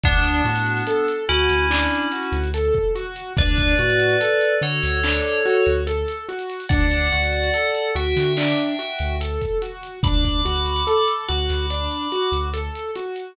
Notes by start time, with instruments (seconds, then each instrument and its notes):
0.03 synth bass 2 D2, tubular bells B3 D4, acoustic grand piano D4, kick, closed hi-hat
0.25 closed hi-hat
0.44 synth bass 2 A2, acoustic grand piano F#4, closed hi-hat
0.56 closed hi-hat
0.66 closed hi-hat
0.77 closed hi-hat
0.87 acoustic grand piano A4, closed hi-hat
1.08 closed hi-hat
1.29 synth bass 2 D2, tubular bells C#4 E4, acoustic grand piano F#4, closed hi-hat
1.49 synth bass 2 D2, snare, closed hi-hat
1.70 acoustic grand piano D4, clap
1.91 closed hi-hat
2.12 acoustic grand piano F#4, closed hi-hat
2.23 closed hi-hat
2.32 synth bass 2 D2, closed hi-hat
2.44 closed hi-hat
2.54 acoustic grand piano A4, closed hi-hat
2.75 kick
2.95 acoustic grand piano F#4, closed hi-hat
3.16 closed hi-hat
3.37 synth bass 2 D2, acoustic grand piano D4, tubular bells B4 D5, kick, closed hi-hat
3.58 kick, closed hi-hat
3.79 synth bass 2 A2, acoustic grand piano F#4, closed hi-hat
3.90 closed hi-hat
4.00 closed hi-hat
4.10 closed hi-hat
4.20 acoustic grand piano A4, closed hi-hat
4.41 closed hi-hat
4.61 synth bass 2 D3, acoustic grand piano F#4, tubular bells A4 C#5, closed hi-hat
4.83 synth bass 2 D2, snare, closed hi-hat
5.03 acoustic grand piano D4, clap
5.24 closed hi-hat
5.45 acoustic grand piano F#4, closed hi-hat
5.66 synth bass 2 D2, closed hi-hat
5.87 acoustic grand piano A4, closed hi-hat
6.08 closed hi-hat
6.29 acoustic grand piano F#4, closed hi-hat
6.39 closed hi-hat
6.50 closed hi-hat
6.60 closed hi-hat
6.69 synth bass 2 D2, acoustic grand piano D4, tubular bells D5 F#5, kick, closed hi-hat
6.91 closed hi-hat
7.12 synth bass 2 D2, acoustic grand piano F#4, closed hi-hat
7.23 closed hi-hat
7.33 closed hi-hat
7.43 closed hi-hat
7.54 acoustic grand piano A4, closed hi-hat
7.75 closed hi-hat
7.95 synth bass 2 D2, acoustic grand piano F#4, tubular bells E5 G5, closed hi-hat
8.16 synth bass 2 D3, snare, closed hi-hat
8.37 acoustic grand piano D4, clap
8.57 closed hi-hat
8.79 acoustic grand piano F#4, closed hi-hat
8.99 synth bass 2 D2, closed hi-hat
9.20 acoustic grand piano A4, closed hi-hat
9.41 kick, closed hi-hat
9.62 acoustic grand piano F#4, closed hi-hat
9.83 closed hi-hat
10.03 synth bass 2 D2, acoustic grand piano D4, tubular bells B5 D6, kick, closed hi-hat
10.24 kick, closed hi-hat
10.45 synth bass 2 D2, acoustic grand piano F#4, closed hi-hat
10.56 closed hi-hat
10.66 closed hi-hat
10.76 closed hi-hat
10.87 acoustic grand piano A4, closed hi-hat
11.08 closed hi-hat
11.28 synth bass 2 D2, acoustic grand piano F#4, tubular bells B5 D6, closed hi-hat
11.49 synth bass 2 D2, snare, closed hi-hat
11.70 acoustic grand piano D4, closed hi-hat
11.91 closed hi-hat
12.12 acoustic grand piano F#4, closed hi-hat
12.32 synth bass 2 D2, closed hi-hat
12.53 acoustic grand piano A4, closed hi-hat
12.75 closed hi-hat
12.95 acoustic grand piano F#4, closed hi-hat
13.16 closed hi-hat